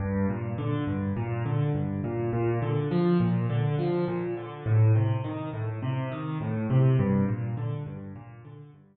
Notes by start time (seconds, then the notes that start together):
0.00 G2
0.29 A#2
0.58 D3
0.87 G2
1.17 A#2
1.46 D3
1.75 G2
2.04 A#2
2.33 A#2
2.62 D3
2.91 F3
3.20 A#2
3.50 D3
3.79 F3
4.08 A#2
4.37 D3
4.66 A2
4.95 C3
5.24 D#3
5.53 A2
5.83 C3
6.12 D#3
6.41 A2
6.70 C3
6.99 G2
7.28 A#2
7.57 D3
7.86 G2
8.16 A#2
8.45 D3
8.74 G2